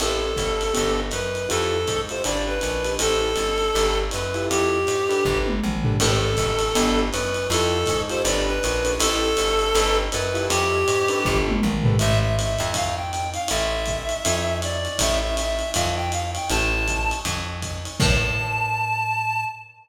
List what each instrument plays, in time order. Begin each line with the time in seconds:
0.00 electric bass (finger) A1, acoustic grand piano C4 E4 G4 A4, clarinet A4, crash, ride
0.36 electric bass (finger) G1, kick, hi-hat pedal, ride
0.61 ride
0.73 electric bass (finger) G1, acoustic grand piano B3 D4 G4 A4, ride
1.11 electric bass (finger) F#2, clarinet B4, hi-hat pedal, ride
1.35 ride
1.49 electric bass (finger) F2, acoustic grand piano E4 F4 G4 A4, clarinet A4, ride
1.87 electric bass (finger) G#2, kick, hi-hat pedal, ride
2.09 acoustic grand piano E4 F4 G4 A4, clarinet C5, ride
2.24 electric bass (finger) G1, acoustic grand piano D4 G4 A4 B4, clarinet D5, ride
2.47 clarinet B4
2.61 electric bass (finger) A#1, hi-hat pedal, ride
2.85 acoustic grand piano D4 G4 A4 B4, ride
2.99 electric bass (finger) A1, acoustic grand piano E4 G4 A4 C5, clarinet A4, ride
3.36 electric bass (finger) G1, hi-hat pedal, ride
3.58 ride
3.74 electric bass (finger) G1, acoustic grand piano D4 G4 A4 B4, ride
4.11 electric bass (finger) F#2, clarinet B4, hi-hat pedal, ride
4.34 acoustic grand piano E4 F4 G4 A4, ride
4.50 electric bass (finger) F2, clarinet G4, ride
4.87 electric bass (finger) G#2, hi-hat pedal, ride
5.09 acoustic grand piano D4 G4 A4 B4, ride
5.25 electric bass (finger) G1, kick
5.46 high tom
5.64 electric bass (finger) A#1, mid tom
5.83 acoustic grand piano D4 G4 A4 B4, floor tom
5.99 electric bass (finger) A1, acoustic grand piano C4 E4 G4 A4, clarinet A4, crash, ride
6.37 electric bass (finger) G1, kick, hi-hat pedal, ride
6.59 ride
6.75 electric bass (finger) G1, acoustic grand piano B3 D4 G4 A4, ride
7.12 electric bass (finger) F#2, clarinet B4, hi-hat pedal, ride
7.34 ride
7.50 electric bass (finger) F2, acoustic grand piano E4 F4 G4 A4, clarinet A4, ride
7.86 electric bass (finger) G#2, kick, hi-hat pedal, ride
8.09 acoustic grand piano E4 F4 G4 A4, clarinet C5, ride
8.24 electric bass (finger) G1, acoustic grand piano D4 G4 A4 B4, clarinet D5, ride
8.46 clarinet B4
8.63 electric bass (finger) A#1, hi-hat pedal, ride
8.84 acoustic grand piano D4 G4 A4 B4, ride
8.99 electric bass (finger) A1, acoustic grand piano E4 G4 A4 C5, clarinet A4, ride
9.37 electric bass (finger) G1, hi-hat pedal, ride
9.59 ride
9.75 electric bass (finger) G1, acoustic grand piano D4 G4 A4 B4, ride
10.12 electric bass (finger) F#2, clarinet B4, hi-hat pedal, ride
10.34 acoustic grand piano E4 F4 G4 A4, ride
10.50 electric bass (finger) F2, clarinet G4, ride
10.88 electric bass (finger) G#2, hi-hat pedal, ride
11.08 acoustic grand piano D4 G4 A4 B4, ride
11.25 electric bass (finger) G1, kick
11.48 high tom
11.62 electric bass (finger) A#1, mid tom
11.83 acoustic grand piano D4 G4 A4 B4, floor tom
11.99 electric bass (finger) A1, clarinet E5, ride
12.22 clarinet E5
12.37 clarinet E5, hi-hat pedal, ride
12.59 electric bass (finger) F2, ride
12.74 clarinet F5, kick, ride
12.97 clarinet G5
13.12 clarinet G5, hi-hat pedal, ride
13.34 clarinet F5, ride
13.48 electric bass (finger) A1, clarinet E5, ride
13.86 kick, hi-hat pedal, ride
14.09 ride
14.25 electric bass (finger) F2, ride
14.62 clarinet D5, hi-hat pedal, ride
14.85 ride
14.99 electric bass (finger) A1, clarinet E5, kick, ride
15.23 clarinet E5
15.37 clarinet E5, hi-hat pedal, ride
15.59 ride
15.74 electric bass (finger) F2, clarinet F5, kick, ride
15.96 clarinet G5
16.12 clarinet F5, hi-hat pedal, ride
16.35 clarinet G5, ride
16.50 electric bass (finger) A1, clarinet A5, ride
16.88 kick, hi-hat pedal, ride
17.11 ride
17.25 electric bass (finger) F2, kick, ride
17.62 kick, hi-hat pedal, ride
17.85 ride
18.00 electric bass (finger) A2, clarinet A5, kick, crash